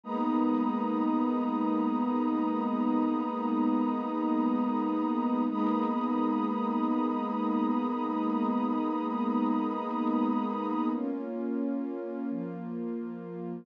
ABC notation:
X:1
M:4/4
L:1/8
Q:1/4=88
K:G#m
V:1 name="Pad 2 (warm)"
[G,A,B,D]8- | [G,A,B,D]8 | [G,A,B,D]8- | [G,A,B,D]8 |
[K:Bbm] [B,DF]4 [F,B,F]4 |]
V:2 name="Pad 2 (warm)"
[Gabd']8- | [Gabd']8 | [Gabd']8- | [Gabd']8 |
[K:Bbm] z8 |]